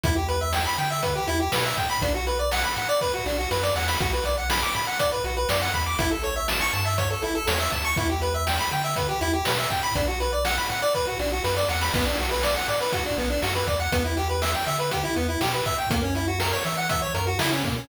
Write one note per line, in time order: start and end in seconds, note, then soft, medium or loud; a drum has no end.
0.04 0.67 E2 medium
0.04 0.15 E4 loud
0.04 kick loud
0.04 closed hi-hat loud
0.16 0.27 G4 medium
0.29 0.40 B4 medium
0.29 closed hi-hat medium
0.41 0.52 E5 medium
0.53 0.64 G5 medium
0.53 snare loud
0.66 0.77 B5 medium
0.78 1.20 D3 medium
0.78 0.89 G5 medium
0.78 closed hi-hat medium
0.90 1.02 E5 medium
1.03 1.14 B4 medium
1.03 kick loud
1.03 closed hi-hat loud
1.15 1.27 G4 medium
1.27 1.49 E2 medium
1.27 1.39 E4 loud
1.27 closed hi-hat medium
1.40 1.51 G4 medium
1.52 1.74 B2 medium
1.52 1.64 B4 medium
1.52 snare loud
1.65 1.76 E5 medium
1.77 1.98 A2 medium
1.77 1.88 G5 medium
1.77 kick medium
1.77 closed hi-hat medium
1.90 2.01 B5 loud
2.02 2.65 B1 medium
2.02 2.13 D4 loud
2.02 kick loud
2.02 closed hi-hat loud
2.14 2.26 F#4 medium
2.27 2.38 B4 medium
2.27 closed hi-hat medium
2.39 2.50 D5 medium
2.51 2.63 F#5 loud
2.51 snare loud
2.64 2.75 B5 medium
2.76 3.19 A2 medium
2.76 2.88 F#5 medium
2.76 closed hi-hat medium
2.89 3.00 D5 loud
3.01 3.12 B4 loud
3.01 kick medium
3.01 snare medium
3.14 3.25 F#4 medium
3.26 3.47 B1 medium
3.26 3.37 D4 medium
3.26 snare medium
3.38 3.49 F#4 medium
3.51 3.72 F#2 medium
3.51 3.62 B4 medium
3.51 snare medium
3.63 3.74 D5 loud
3.63 snare medium
3.76 3.97 E2 medium
3.76 3.87 F#5 medium
3.76 snare loud
3.88 3.99 B5 medium
3.88 snare loud
4.00 4.64 B1 medium
4.00 4.11 F#4 loud
4.00 kick loud
4.00 closed hi-hat loud
4.13 4.24 B4 medium
4.25 4.36 D5 medium
4.25 closed hi-hat medium
4.38 4.49 F#5 medium
4.50 4.61 B5 loud
4.50 snare loud
4.62 4.74 D6 medium
4.75 5.17 A2 medium
4.75 4.86 B5 medium
4.75 closed hi-hat medium
4.87 4.98 F#5 medium
4.99 5.11 D5 loud
4.99 kick medium
4.99 closed hi-hat loud
5.12 5.23 B4 medium
5.24 5.45 B1 medium
5.24 5.36 F#4 medium
5.24 closed hi-hat medium
5.37 5.48 B4 medium
5.49 5.70 F#2 medium
5.49 5.60 D5 medium
5.49 snare loud
5.62 5.73 F#5 loud
5.74 5.95 E2 medium
5.74 5.85 B5 medium
5.74 kick medium
5.74 closed hi-hat medium
5.86 5.98 D6 medium
5.99 6.62 A1 medium
5.99 6.10 E4 loud
5.99 kick loud
5.99 closed hi-hat loud
6.11 6.22 A4 medium
6.23 6.35 C#5 medium
6.23 closed hi-hat medium
6.36 6.47 E5 medium
6.48 6.60 A5 medium
6.48 snare loud
6.61 6.72 C#6 loud
6.73 7.15 G2 medium
6.73 6.84 A5 loud
6.73 closed hi-hat medium
6.85 6.97 E5 medium
6.98 7.09 C#5 loud
6.98 kick loud
6.98 closed hi-hat loud
7.10 7.21 A4 medium
7.22 7.44 A1 medium
7.22 7.34 E4 medium
7.22 closed hi-hat medium
7.35 7.46 A4 loud
7.47 7.69 E2 medium
7.47 7.59 C#5 medium
7.47 snare loud
7.60 7.71 E5 medium
7.72 7.93 D2 medium
7.72 7.83 A5 medium
7.72 kick medium
7.72 closed hi-hat medium
7.85 7.96 C#6 loud
7.96 8.60 E2 medium
7.96 8.08 E4 loud
7.96 kick loud
7.96 closed hi-hat loud
8.10 8.21 G4 medium
8.21 8.33 B4 medium
8.21 closed hi-hat medium
8.34 8.45 E5 medium
8.47 8.58 G5 medium
8.47 snare loud
8.59 8.70 B5 medium
8.71 9.14 D3 medium
8.71 8.83 G5 medium
8.71 closed hi-hat medium
8.84 8.95 E5 medium
8.96 9.07 B4 medium
8.96 kick loud
8.96 closed hi-hat loud
9.09 9.20 G4 medium
9.21 9.42 E2 medium
9.21 9.32 E4 loud
9.21 closed hi-hat medium
9.33 9.45 G4 medium
9.45 9.67 B2 medium
9.45 9.57 B4 medium
9.45 snare loud
9.58 9.69 E5 medium
9.70 9.92 A2 medium
9.70 9.82 G5 medium
9.70 kick medium
9.70 closed hi-hat medium
9.83 9.94 B5 loud
9.95 10.59 B1 medium
9.95 10.07 D4 loud
9.95 kick loud
9.95 closed hi-hat loud
10.08 10.19 F#4 medium
10.20 10.31 B4 medium
10.20 closed hi-hat medium
10.33 10.44 D5 medium
10.45 10.56 F#5 loud
10.45 snare loud
10.58 10.69 B5 medium
10.70 11.12 A2 medium
10.70 10.81 F#5 medium
10.70 closed hi-hat medium
10.82 10.93 D5 loud
10.94 11.06 B4 loud
10.94 kick medium
10.94 snare medium
11.07 11.18 F#4 medium
11.19 11.40 B1 medium
11.19 11.31 D4 medium
11.19 snare medium
11.32 11.43 F#4 medium
11.44 11.65 F#2 medium
11.44 11.55 B4 medium
11.44 snare medium
11.57 11.68 D5 loud
11.57 snare medium
11.68 11.90 E2 medium
11.68 11.80 F#5 medium
11.68 snare loud
11.81 11.92 B5 medium
11.81 snare loud
11.94 12.57 B1 medium
11.94 12.05 B3 loud
11.94 kick loud
11.94 crash loud
12.06 12.17 D4 loud
12.18 12.30 F#4 medium
12.18 closed hi-hat medium
12.31 12.42 B4 medium
12.43 12.55 D5 loud
12.43 snare loud
12.56 12.67 F#5 loud
12.68 13.10 A2 medium
12.68 12.79 D5 medium
12.68 closed hi-hat medium
12.81 12.92 B4 medium
12.92 13.04 F#4 loud
12.92 kick loud
12.92 closed hi-hat loud
13.05 13.17 D4 medium
13.18 13.39 B1 medium
13.18 13.29 B3 medium
13.18 closed hi-hat medium
13.30 13.41 D4 medium
13.42 13.64 F#2 medium
13.42 13.54 F#4 medium
13.42 snare loud
13.55 13.66 B4 medium
13.67 13.88 E2 medium
13.67 13.78 D5 medium
13.67 kick loud
13.67 closed hi-hat medium
13.80 13.91 F#5 medium
13.92 14.55 E2 medium
13.92 14.03 B3 loud
13.92 kick loud
13.92 closed hi-hat loud
14.05 14.16 E4 medium
14.17 14.28 G4 loud
14.17 closed hi-hat medium
14.29 14.40 B4 medium
14.42 14.53 E5 medium
14.42 snare loud
14.54 14.65 G5 medium
14.66 15.09 D3 medium
14.66 14.78 E5 medium
14.66 closed hi-hat medium
14.79 14.90 B4 medium
14.91 15.03 G4 medium
14.91 kick medium
14.91 closed hi-hat loud
15.04 15.15 E4 medium
15.16 15.37 E2 medium
15.16 15.27 B3 medium
15.16 closed hi-hat medium
15.29 15.40 E4 medium
15.41 15.62 B2 medium
15.41 15.52 G4 loud
15.41 snare loud
15.53 15.64 B4 medium
15.66 15.87 A2 medium
15.66 15.77 E5 medium
15.66 kick medium
15.66 closed hi-hat medium
15.78 15.89 G5 medium
15.90 16.54 F#2 medium
15.90 16.02 A#3 loud
15.90 kick loud
15.90 closed hi-hat loud
16.03 16.14 C#4 medium
16.15 16.26 E4 medium
16.15 closed hi-hat medium
16.28 16.39 F#4 medium
16.40 16.51 A#4 loud
16.40 snare loud
16.52 16.64 C#5 medium
16.65 17.07 E3 medium
16.65 16.76 E5 medium
16.65 closed hi-hat medium
16.77 16.88 F#5 medium
16.89 17.01 E5 medium
16.89 kick loud
16.89 closed hi-hat loud
17.02 17.13 C#5 medium
17.14 17.36 F#2 medium
17.14 17.26 A#4 medium
17.14 closed hi-hat loud
17.27 17.38 F#4 medium
17.39 17.60 C#3 medium
17.39 17.50 E4 loud
17.39 snare loud
17.52 17.63 C#4 loud
17.64 17.85 B2 medium
17.64 17.75 A#3 medium
17.64 kick loud
17.64 closed hi-hat medium
17.77 17.88 C#4 medium